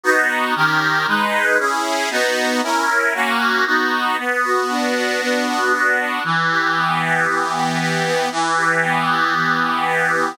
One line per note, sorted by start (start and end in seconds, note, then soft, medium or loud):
0.04 0.54 B3 medium
0.04 0.54 D#4 medium
0.04 0.54 F#4 medium
0.56 1.06 D#3 medium
0.56 1.06 C#4 medium
0.56 1.06 G4 medium
0.56 1.06 A#4 loud
1.07 1.58 G#3 medium
1.07 1.58 D#4 medium
1.07 1.58 B4 medium
1.58 2.09 C#4 medium
1.58 2.09 E4 medium
1.58 2.09 G#4 medium
2.10 2.61 B3 medium
2.10 2.61 D#4 medium
2.10 2.61 F#4 medium
2.63 3.13 C#4 medium
2.63 3.13 E4 medium
2.63 3.13 A#4 medium
3.14 3.65 A#3 medium
3.14 3.65 C#4 loud
3.14 3.65 F#4 loud
3.66 4.16 B3 medium
3.66 4.16 D#4 medium
3.66 4.16 F#4 loud
4.18 5.20 B3 medium
4.44 4.95 F#4 medium
4.69 5.98 D4 medium
4.95 5.46 F#4 medium
5.21 6.19 B3 medium
5.47 5.72 F#4 medium
5.72 6.22 F#4 medium
5.99 6.23 D4 medium
6.24 7.27 E3 medium
6.50 7.02 G4 medium
6.76 8.05 B3 medium
7.02 7.53 G4 medium
7.27 8.26 E3 medium
7.54 7.79 G4 medium
7.80 8.29 G4 medium
8.05 8.30 B3 medium
8.31 9.34 E3 loud
8.57 9.08 G4 medium
8.83 10.12 B3 medium
9.09 9.60 G4 medium
9.35 10.33 E3 medium
9.61 9.85 G4 medium
9.86 10.35 G4 medium
10.12 10.37 B3 medium